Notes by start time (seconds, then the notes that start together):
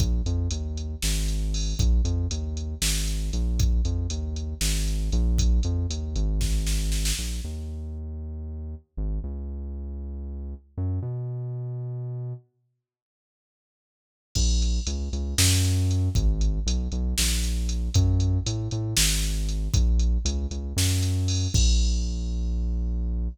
0.00 A#1, kick, closed hi-hat
0.26 F2, closed hi-hat
0.51 D#2, closed hi-hat
0.77 closed hi-hat
1.02 G#1, snare
1.28 closed hi-hat
1.54 open hi-hat
1.79 A#1, kick, closed hi-hat
2.05 F2, closed hi-hat
2.31 D#2, closed hi-hat
2.57 closed hi-hat
2.82 G#1, snare
3.08 closed hi-hat
3.33 A#1, closed hi-hat
3.59 kick, closed hi-hat
3.85 F2, closed hi-hat
4.10 D#2, closed hi-hat
4.36 closed hi-hat
4.61 G#1, snare
4.88 closed hi-hat
5.12 A#1, closed hi-hat
5.38 kick, closed hi-hat
5.63 F2, closed hi-hat
5.90 D#2, closed hi-hat
6.16 G#1, closed hi-hat
6.41 kick, snare
6.67 snare
6.92 snare
7.05 snare
7.19 A#1
7.44 D#2
8.97 G#1
9.24 C#2
10.78 F#2
11.02 B2
14.35 A#1, kick, crash
14.62 closed hi-hat
14.87 C#2, closed hi-hat
15.13 C#2, closed hi-hat
15.38 F#2, snare
15.65 closed hi-hat
15.91 closed hi-hat
16.15 G#1, kick, closed hi-hat
16.41 closed hi-hat
16.66 B1, closed hi-hat
16.92 B1, closed hi-hat
17.18 A#1, snare
17.44 closed hi-hat
17.69 closed hi-hat
17.94 F#2, kick, closed hi-hat
18.20 closed hi-hat
18.46 A2, closed hi-hat
18.71 A2, closed hi-hat
18.97 G#1, snare
19.24 closed hi-hat
19.49 closed hi-hat
19.74 A#1, kick, closed hi-hat
19.99 closed hi-hat
20.25 C#2, closed hi-hat
20.51 C#2, closed hi-hat
20.76 F#2, snare
21.02 closed hi-hat
21.28 open hi-hat
21.54 A#1, kick, crash